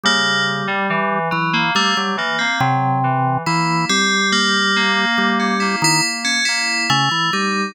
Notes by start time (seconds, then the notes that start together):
0.04 C#3 G3 A#3
0.68 G3
0.90 E3
1.31 E3 F#3
1.53 A#3
1.75 G3 A3 A#3
1.96 F#3 G3
2.17 E3 A#3
2.39 A#3 C4
2.60 C3 F#3
3.04 E3
3.46 E3 A#3 E4
3.89 G3 C4
4.32 A#3
4.76 A#3
5.18 G3
5.40 C#4
5.60 A#3 E4
5.82 D#3 E4
6.25 C#4
6.45 A#3 E4
6.90 C#3 A3
7.11 E3
7.33 G3 D#4